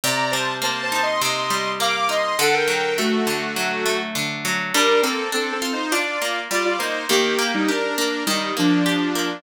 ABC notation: X:1
M:4/4
L:1/16
Q:1/4=102
K:Gm
V:1 name="Lead 2 (sawtooth)"
[db]2 [ca]2 (3[ca]2 [ca]2 [ec']2 [ec']4 [fd'] [fd'] [ec']2 | [A^f] [Bg]3 [A,^F]8 z4 | [DB]2 [CA]2 (3[CA]2 [CA]2 [Ec]2 [Fd]4 [Fd] [Fd] [Ec]2 | [B,G]3 [G,E] [DB]2 [DB]2 [G,E]2 [F,D]6 |]
V:2 name="Acoustic Guitar (steel)"
C,2 G,2 B,2 E2 C,2 G,2 B,2 E2 | D,2 ^F,2 A,2 D,2 F,2 A,2 D,2 F,2 | G,2 B,2 D2 F2 D2 B,2 G,2 B,2 | E,2 B,2 G2 B,2 E,2 B,2 G2 B,2 |]